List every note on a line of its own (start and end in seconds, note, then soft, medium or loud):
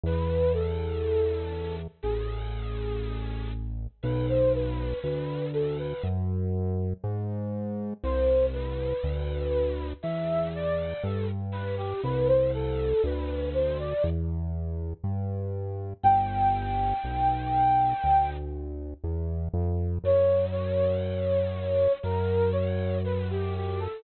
0.04 1.88 E2 medium
0.04 0.53 B4 loud
0.54 1.75 A4 medium
2.03 3.88 A1 medium
2.03 3.49 G#4 medium
4.03 4.94 B1 loud
4.03 4.26 B4 medium
4.29 4.53 C5 medium
4.55 4.99 B4 medium
5.03 5.94 D2 medium
5.03 5.45 B4 medium
5.54 5.77 A4 medium
5.79 6.03 B4 medium
6.04 6.94 F#2 medium
7.04 7.94 G#2 loud
8.04 8.94 C2 loud
8.04 8.46 C5 loud
8.53 9.87 B4 medium
9.04 9.94 D2 medium
10.03 10.94 E2 medium
10.03 10.49 E5 medium
10.55 11.03 D5 medium
11.03 11.94 G2 medium
11.03 11.26 A4 medium
11.52 11.76 B4 loud
11.77 12.01 G4 loud
12.03 12.94 C2 loud
12.03 12.27 B4 loud
12.28 12.51 C5 medium
12.54 13.02 A4 loud
13.04 13.94 D2 loud
13.04 13.49 B4 medium
13.54 13.78 C5 medium
13.79 14.03 D5 loud
14.04 14.94 E2 medium
15.04 15.94 G2 medium
16.03 16.94 G1 loud
16.03 18.30 G5 loud
17.04 17.94 B1 medium
18.04 18.94 D2 medium
19.04 19.49 E2 medium
19.54 19.99 F2 loud
20.04 21.88 F#2 medium
20.04 20.46 C#5 loud
20.52 21.92 C#5 medium
22.03 23.88 F#2 medium
22.03 22.50 A#4 loud
22.52 22.98 C#5 medium
23.04 23.28 B4 medium
23.30 23.54 G4 loud
23.56 23.80 G4 medium
23.80 24.03 A4 loud